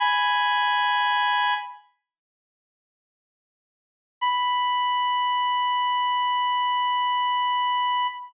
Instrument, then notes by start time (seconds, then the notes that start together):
clarinet
0.00 G#5 B5
4.21 B5